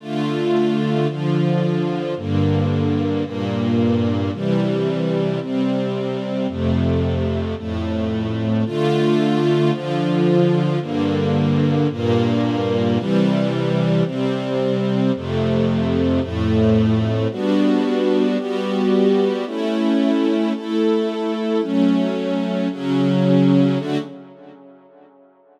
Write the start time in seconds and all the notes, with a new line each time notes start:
0.00 D3 A3 F4
1.07 D3 F3 F4
2.17 G2 D3 A#3
3.24 G2 A#2 A#3
4.33 C3 E3 G3
5.40 C3 G3 C4
6.48 F2 C3 A3
7.57 F2 A2 A3
8.66 D3 A3 F4
9.72 D3 F3 F4
10.80 G2 D3 A#3
11.91 G2 A#2 A#3
12.96 C3 E3 G3
14.05 C3 G3 C4
15.15 F2 C3 A3
16.20 F2 A2 A3
17.31 G3 B3 D4 F#4
18.38 G3 B3 F#4 G4
19.46 A3 C#4 E4
20.54 A3 E4 A4
21.61 F#3 A3 C#4
22.71 C#3 F#3 C#4
23.78 D3 A3 F#4